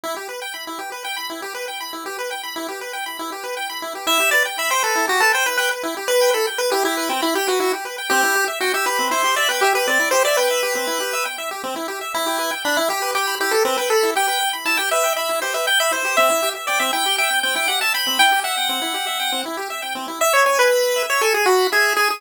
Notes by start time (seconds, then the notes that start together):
0.03 E4
0.16 G4
0.29 B4
0.42 G5
0.54 B5
0.67 E4
0.79 G4
0.92 B4
1.04 G5
1.16 B5
1.30 E4
1.42 G4
1.55 B4
1.68 G5
1.80 B5
1.93 E4
2.06 G4
2.19 B4
2.31 G5
2.43 B5
2.56 E4
2.68 G4
2.81 B4
2.93 G5
3.06 B5
3.19 E4
3.32 G4
3.44 B4
3.57 G5
3.69 B5
3.82 E4
3.95 G4
4.07 E4 E5
4.20 G4
4.31 B4 D5
4.45 G5
4.58 E5 B5
4.70 C5 G5
4.82 A4 B4
4.95 E4
5.07 F#4 G4
5.20 A4 B4
5.33 C5 G5
5.46 B4 B5
5.57 B4 G5
5.71 B4
5.83 E4
5.97 G4
6.08 B4
6.21 G5
6.33 A4 B5
6.47 G5
6.58 B4
6.71 E4 G4
6.85 E4 G4
6.97 B4
7.09 C4 G5
7.22 E4 B5
7.35 G4 G5
7.48 F#4 B4
7.60 E4 F#4
7.73 G4
7.85 B4
7.98 G5
8.10 C4 G4
8.23 E4
8.35 G4
8.48 E5
8.60 F#4 G5
8.74 G4 E5
8.86 G4 B4
8.99 C4
9.11 E4 C5
9.24 G4
9.36 D5 E5
9.49 B4 G5
9.61 G4 E5
9.75 G4 B4
9.87 C4 D5
9.99 E4
10.11 G4 C5
10.25 D5 E5
10.37 B4 G5
10.51 E5
10.63 G4
10.75 C4
10.87 E4
11.00 G4
11.13 E5
11.25 G5
11.38 E5
11.51 G4
11.64 C4
11.76 E4
11.88 G4
12.01 E5
12.14 E4
12.26 G4
12.39 B4
12.51 G5
12.64 D4 B5
12.77 E4
12.89 G4
13.02 B4
13.15 G4 G5
13.27 B5
13.40 E4 G4
13.51 G4 A4
13.65 C4 B4
13.77 B4 G5
13.90 A4 B5
14.03 E4
14.15 G4 G5
14.28 B4
14.41 G5
14.53 B5
14.65 E4 A5
14.77 G4 G5
14.91 B4 E5
15.04 G5
15.16 E5 B5
15.29 E4
15.42 G4 C5
15.54 B4 E5
15.67 G5
15.80 E5 B5
15.91 E4 C5
16.05 G4
16.17 C4 E5
16.30 E4
16.42 G4
16.55 E5
16.67 D5 G5
16.79 C4 E5
16.93 E4 G5
17.06 G4
17.18 E5 G5
17.30 G5
17.43 C4 G5
17.55 E4 G5
17.68 G4 F#5
17.81 E5 A5
17.94 G5 B5
18.07 C4
18.19 E4 G5
18.32 G4
18.44 E5 F#5
18.57 G5
18.69 C4
18.82 E4
18.94 G4
19.07 E5
19.20 G5
19.32 C4
19.46 E4
19.57 G4
19.70 E5
19.82 G5
19.95 C4
20.08 E4
20.21 E5
20.33 C#5
20.46 C#5 G#5
20.59 B4
20.71 B5
20.96 E5
21.10 C#5
21.21 A4 G#5
21.34 G#4
21.46 F#4 B5
21.72 G#4 E5
21.96 G#4 G#5
22.10 G#4